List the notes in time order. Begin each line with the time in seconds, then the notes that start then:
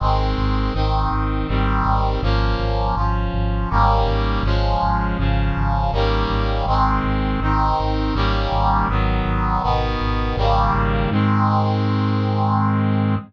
0.00 G#1 D#3 G#3 C4
0.38 G#1
0.74 G#1 D#3 C4 D#4
1.11 G#1
1.48 G#1 D#3 G3 C4
1.85 G#1
2.22 G#1 F3 A#3 C#4
2.59 G#1
2.96 G#1 F3 C#4 F4
3.33 G#1
3.70 G#1 D#3 G3 A#3 C#4
4.06 G#1
4.43 G#1 F3 G#3 C#4
4.82 G#1
5.18 G#1 C#3 F3 C#4
5.57 G#1
5.92 G#1 D#3 G3 A#3 C#4
6.30 G#1
6.66 G#1 D#3 G#3 C4
7.04 G#1
7.40 G#1 D#3 C4 D#4
7.79 G#1
8.14 G#1 D#3 G3 A#3 C#4
8.51 G#1
8.89 G#1 D#3 F#3 B3
9.25 G#1
9.63 G#1 B2 D#3 B3
10.00 G#1
10.37 G#1 C#3 D#3 G3 A#3
10.73 G#1
11.11 G#2 D#3 G#3 C4